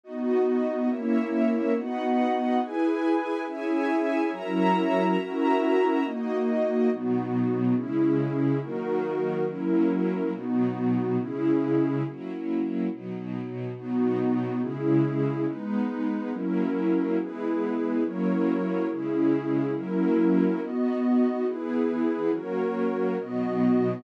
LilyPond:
<<
  \new Staff \with { instrumentName = "String Ensemble 1" } { \time 6/8 \key b \major \tempo 4. = 70 <b fis' dis''>4. <ais' cis'' e''>4. | <b' dis'' fis''>4. <e' b' gis''>4. | <cis'' e'' gis''>4. <fis' cis'' e'' ais''>4. | <cis' fis' e'' ais''>4. <ais fis' dis''>4. |
<b, fis dis'>4. <cis gis e'>4. | <dis fis ais>4. <fis ais cis' e'>4. | <b, fis dis'>4. <cis gis e'>4. | <fis ais cis' e'>4. <b, fis dis'>4. |
<b, fis dis'>4. <cis gis e'>4. | <gis b dis'>4. <fis ais cis' e'>4. | <e gis b>4. <fis ais cis' e'>4. | <cis gis e'>4. <fis ais cis' e'>4. |
<b dis' fis'>4. <e b gis'>4. | <fis ais cis'>4. <b, fis dis'>4. | }
  \new Staff \with { instrumentName = "Pad 2 (warm)" } { \time 6/8 \key b \major <b dis' fis'>4. <ais cis' e'>4. | <b dis' fis'>4. <e' gis' b'>4. | <cis' e' gis'>4. <fis cis' e' ais'>4. | <cis' e' fis' ais'>4. <ais dis' fis'>4. |
<b dis' fis'>4. <cis' e' gis'>4. | <dis' fis' ais'>4. <fis cis' e' ais'>4. | <b dis' fis'>4. <cis' e' gis'>4. | r2. |
<b dis' fis'>4. <cis' e' gis'>4. | <gis dis' b'>4. <fis cis' e' ais'>4. | <e' gis' b'>4. <fis e' ais' cis''>4. | <cis' e' gis'>4. <fis cis' e' ais'>4. |
<b fis' dis''>4. <e' gis' b'>4. | <fis' ais' cis''>4. <b fis' dis''>4. | }
>>